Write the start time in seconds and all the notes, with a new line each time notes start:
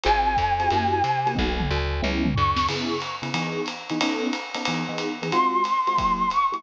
0.04 G#1 C4 F4 F#4 G#4 G#5, ride
0.37 F2, kick, hi-hat pedal, ride
0.60 C4 F4 F#4 G#4, ride
0.70 F#2 A#3 E4 F#4 G4, ride
1.04 C3, hi-hat pedal, ride
1.27 A#3 E4 F#4 G4, ride
1.35 B1 A#3 B3 D#4 F#4, kick, high tom
1.60 mid tom
1.71 D2
2.02 C#2 G#3 B3 C#4 E4, high tom
2.25 mid tom
2.34 D2 C#6, floor tom
2.56 snare
2.68 C#3 B3 E4 G#4, crash, ride
3.01 hi-hat pedal, ride
3.22 C#3 B3 E4 G#4, ride
3.34 E3 B3 D#4 G#4, ride
3.66 hi-hat pedal, ride
3.89 E3 B3 D#4 G#4, ride
4.01 B3 C#4 D#4 A4, ride
4.33 hi-hat pedal, ride
4.54 B3 C#4 D#4 A4, ride
4.65 E3 B3 D#4 G#4, ride
4.89 E3 B3 D#4 G#4
4.98 hi-hat pedal, ride
5.22 E3 B3 D#4 G#4, ride
5.32 G#3 C4 F4 F#4 C6, ride
5.64 hi-hat pedal, ride
5.87 G#3 C4 F4 F#4, ride
5.97 F#3 A#3 E4 G4, kick, ride
6.30 C#6, hi-hat pedal, ride
6.52 F#3 A#3 E4 G4, ride